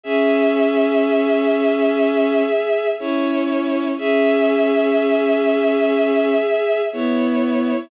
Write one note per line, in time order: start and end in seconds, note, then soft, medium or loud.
0.03 2.42 C#4 medium
0.03 2.88 G#4 medium
0.03 2.88 E5 medium
2.99 3.92 C#4 medium
2.99 3.88 E4 medium
2.99 3.88 C#5 medium
3.97 6.34 C#4 medium
3.97 6.82 G#4 medium
3.97 6.82 E5 medium
6.92 7.72 B3 medium
6.92 7.80 E4 medium
6.92 7.80 C#5 medium